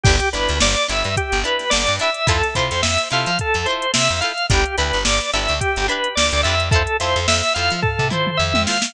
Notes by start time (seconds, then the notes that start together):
0.03 G1 D4 E4 G4, kick, crash
0.09 B4
0.20 closed hi-hat
0.33 G1 D4 E4 G4 B4, closed hi-hat
0.37 B4
0.48 D2, snare, closed hi-hat
0.60 G1 D5, snare
0.77 closed hi-hat
0.88 G1 D4 E4 G4 B4 E5, closed hi-hat
1.04 G2, closed hi-hat
1.17 G4, kick, closed hi-hat
1.32 G1, closed hi-hat
1.44 D4 E4 G4 B4, closed hi-hat
1.59 snare, closed hi-hat
1.70 G1 D5, snare
1.87 G2, closed hi-hat
1.99 D4 E4 G4 B4 E5, closed hi-hat
2.14 closed hi-hat
2.27 F2 E4 F4 A4 C5, kick, closed hi-hat
2.43 snare, closed hi-hat
2.55 C3 E4 F4 A4 C5, kick, closed hi-hat
2.71 F2, closed hi-hat
2.83 F2 E5, snare
2.98 closed hi-hat
3.10 C3 E4 F4 A4 C5 F5, snare, closed hi-hat
3.26 F3, closed hi-hat
3.39 A4, kick, closed hi-hat
3.54 F2, closed hi-hat
3.66 E4 F4 A4 C5, closed hi-hat
3.70 C5
3.82 closed hi-hat
3.94 C3 E5, snare
4.09 F2, closed hi-hat
4.21 E4 F4 A4 F5, closed hi-hat
4.25 C5
4.38 closed hi-hat
4.50 G1 D4 E4 G4, kick, closed hi-hat
4.54 B4
4.66 closed hi-hat
4.78 D2 D4 E4 G4 B4, closed hi-hat
4.93 G1, closed hi-hat
5.05 G1 D5, snare
5.21 closed hi-hat
5.33 G1 D4 E4 G4 B4 E5, snare, closed hi-hat
5.48 D2, snare, closed hi-hat
5.60 G4, kick, closed hi-hat
5.76 G1, closed hi-hat
5.88 D4 E4 G4 B4, closed hi-hat
6.04 closed hi-hat
6.15 D2 D5, snare
6.32 D2, closed hi-hat
6.43 F2 D4 E4 G4 E5, closed hi-hat
6.48 B4
6.60 closed hi-hat
6.71 E4 F4 A4, kick, closed hi-hat
6.76 C5
6.87 closed hi-hat
7.00 F2 E4 F4 A4 C5, closed hi-hat
7.16 F2, closed hi-hat
7.28 F2 E5, snare
7.43 snare, closed hi-hat
7.54 F2 E4 F4 A4 F5, snare, closed hi-hat
7.59 C5
7.70 F3, closed hi-hat
7.82 A4, kick, floor tom
7.99 C3, floor tom
8.10 E4 F4 A4 C5, mid tom
8.27 mid tom
8.37 F2 E5
8.54 F2, high tom
8.66 E4 F4 A4 F5, snare
8.70 C5
8.82 snare